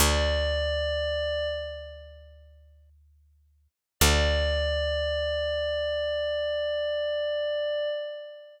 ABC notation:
X:1
M:4/4
L:1/8
Q:1/4=60
K:D
V:1 name="Pad 5 (bowed)"
d3 z5 | d8 |]
V:2 name="Electric Bass (finger)" clef=bass
D,,8 | D,,8 |]